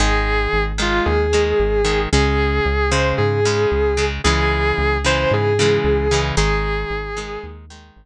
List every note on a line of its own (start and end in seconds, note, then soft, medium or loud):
0.00 0.48 G#1 loud
0.00 0.72 D#3 loud
0.00 0.72 G#3 loud
0.00 0.64 G#4 loud
0.53 1.01 G#1 medium
0.78 1.27 D#3 medium
0.78 1.27 G#3 loud
0.78 1.07 F4 medium
1.06 1.54 D#2 medium
1.06 2.00 G#4 medium
1.33 1.82 D#3 medium
1.33 1.82 G#3 medium
1.60 2.07 G#1 medium
1.85 2.09 D#3 loud
1.85 2.09 G#3 loud
2.12 2.60 C#2 loud
2.12 2.86 C#3 loud
2.12 2.86 G#3 loud
2.12 2.90 G#4 medium
2.65 3.13 C#2 loud
2.91 3.40 C#3 loud
2.91 3.40 G#3 loud
2.91 3.14 C5 medium
3.18 3.66 G#2 loud
3.18 4.04 G#4 medium
3.45 3.94 C#3 loud
3.45 3.94 G#3 medium
3.72 4.19 C#2 medium
3.97 4.22 C#3 medium
3.97 4.22 G#3 loud
4.24 4.73 C#2 loud
4.24 4.98 C#3 loud
4.24 4.98 E3 loud
4.24 4.98 G#3 loud
4.24 4.97 G#4 loud
4.78 5.26 C#2 medium
5.04 5.53 C#3 loud
5.04 5.53 E3 loud
5.04 5.53 G#3 medium
5.04 5.31 C5 loud
5.31 5.79 G#2 loud
5.31 6.20 G#4 medium
5.59 6.08 C#3 loud
5.59 6.08 E3 loud
5.59 6.08 G#3 loud
5.84 6.32 C#2 loud
6.11 6.36 C#3 medium
6.11 6.36 E3 loud
6.11 6.36 G#3 loud
6.37 6.85 G#1 loud
6.37 7.10 D#3 loud
6.37 7.10 G#3 loud
6.37 7.45 G#4 medium
6.90 7.38 G#1 medium
7.17 7.65 D#3 medium
7.17 7.65 G#3 loud
7.43 7.91 D#2 medium
7.70 8.06 D#3 medium
7.70 8.06 G#3 medium
7.96 8.06 G#1 loud